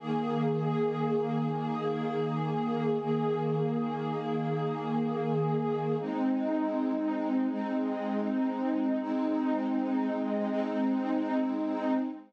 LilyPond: \new Staff { \time 6/8 \key ees \mixolydian \tempo 4. = 80 <ees bes aes'>2.~ | <ees bes aes'>2. | <ees bes aes'>2.~ | <ees bes aes'>2. |
\key aes \mixolydian <aes c' ees'>2. | <aes c' ees'>2. | <aes c' ees'>2. | <aes c' ees'>2. | }